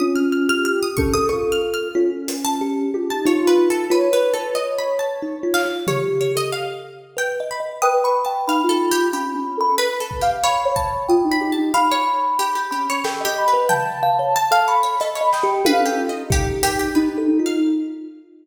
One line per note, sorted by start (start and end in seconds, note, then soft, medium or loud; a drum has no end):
0.00 0.44 C#4 medium
0.00 0.88 F4 medium
0.00 0.14 D#6 medium
0.15 0.30 F6 medium
0.32 0.47 F6 medium
0.48 0.92 G4 soft
0.48 0.64 F6 loud
0.65 0.80 F6 loud
0.83 0.97 D#6 loud
0.97 1.13 C#4 medium
0.97 1.27 A4 medium
0.97 1.11 C#6 loud
0.97 kick medium
1.14 1.29 A4 loud
1.14 1.28 D#6 loud
1.29 1.89 F4 medium
1.29 1.88 A4 loud
1.29 1.49 C#6 medium
1.52 1.72 F6 medium
1.74 1.93 F6 medium
1.95 2.83 C#4 loud
1.95 2.10 F4 loud
2.28 closed hi-hat loud
2.45 2.59 A5 loud
2.61 2.91 G4 medium
2.94 3.09 F4 medium
2.94 3.09 G4 loud
3.10 3.25 D#4 medium
3.10 3.25 A5 medium
3.26 3.55 D#4 loud
3.26 3.85 F4 loud
3.26 3.46 C#5 medium
3.47 3.67 B4 loud
3.58 3.88 F4 soft
3.70 3.90 A4 medium
3.90 4.10 F4 loud
3.90 4.11 B4 medium
3.90 5.67 C#5 medium
4.13 4.33 B4 medium
4.34 4.53 A4 medium
4.34 4.54 B4 medium
4.55 4.75 D#5 medium
4.79 4.98 B5 medium
4.99 5.19 A5 medium
5.22 5.42 D#4 medium
5.43 5.63 F4 medium
5.54 5.69 F5 loud
5.54 clap medium
5.65 5.85 F4 soft
5.87 6.32 G4 loud
5.87 6.02 C#5 medium
5.87 floor tom medium
6.21 6.35 C#5 medium
6.35 6.50 A4 medium
6.35 6.51 D#5 loud
6.52 7.11 F5 medium
7.17 7.36 B4 medium
7.17 7.33 G5 medium
7.40 7.60 D#5 medium
7.51 7.65 B5 medium
7.60 7.80 D#5 soft
7.82 8.41 B4 loud
7.82 8.02 G5 loud
7.82 8.01 D#6 loud
8.04 8.24 B5 medium
8.04 8.24 C#6 medium
8.25 8.45 G5 medium
8.25 8.44 A5 medium
8.47 8.62 D#4 medium
8.47 8.68 F5 loud
8.47 9.06 B5 medium
8.64 9.08 F4 loud
8.69 8.89 A4 medium
8.91 9.11 G4 loud
9.13 9.32 C#4 medium
9.13 9.28 G4 medium
9.13 9.58 B5 medium
9.35 9.54 C#4 medium
9.57 9.77 A4 loud
9.57 9.75 B5 loud
9.78 9.98 B4 loud
9.78 10.18 B4 soft
10.00 10.20 A4 medium
10.11 kick medium
10.21 10.41 G4 medium
10.21 10.61 F5 medium
10.43 10.73 C#5 loud
10.43 11.03 B5 medium
10.65 11.04 C#5 medium
10.76 11.05 A5 medium
10.76 kick medium
11.08 11.23 F4 medium
11.08 11.53 G5 medium
11.08 11.29 D#6 medium
11.24 11.39 D#4 medium
11.32 11.51 B5 medium
11.41 11.56 G4 loud
11.52 11.72 A5 medium
11.57 11.72 D#4 medium
11.74 11.89 F5 loud
11.74 12.62 B5 loud
11.91 12.35 C#5 loud
12.39 12.54 G4 medium
12.55 12.70 G4 medium
12.71 13.01 C#4 medium
12.71 12.87 G4 medium
12.71 13.00 B5 medium
12.90 13.04 C#5 medium
13.04 13.24 G4 medium
13.04 13.19 A4 loud
13.04 13.49 G5 medium
13.04 snare medium
13.20 13.35 D#5 medium
13.25 13.44 G4 loud
13.38 13.67 B5 medium
13.48 13.67 B4 medium
13.53 13.68 B4 medium
13.69 13.98 F5 medium
13.69 14.28 G5 loud
13.69 14.57 A5 loud
13.69 floor tom medium
14.03 14.18 F5 loud
14.19 14.34 C#5 medium
14.36 14.51 A5 loud
14.51 14.95 A4 medium
14.51 14.66 F5 loud
14.67 14.82 C#5 medium
14.67 15.11 B5 medium
14.83 14.98 C#5 medium
15.00 15.16 A4 medium
15.00 15.20 D#5 loud
15.00 closed hi-hat medium
15.15 15.30 C#5 medium
15.15 15.31 B5 medium
15.21 15.40 D#5 medium
15.32 15.63 D#5 medium
15.32 15.62 G5 medium
15.32 snare medium
15.43 15.63 G4 loud
15.65 16.23 A4 medium
15.65 15.86 B4 loud
15.65 15.80 F5 loud
15.65 high tom loud
15.81 15.96 A4 medium
15.86 16.05 G4 medium
15.98 16.12 F4 loud
16.09 16.29 D#5 medium
16.15 16.88 D#4 medium
16.30 16.89 G4 medium
16.30 16.47 G4 loud
16.30 kick loud
16.63 16.78 G4 loud
16.63 closed hi-hat loud
16.79 16.94 G4 medium
16.95 17.25 D#4 loud
16.95 17.15 D#4 medium
16.95 17.24 B4 medium
17.18 17.37 A4 medium
17.27 17.57 D#4 medium
17.39 17.59 F4 medium
17.46 17.61 F5 medium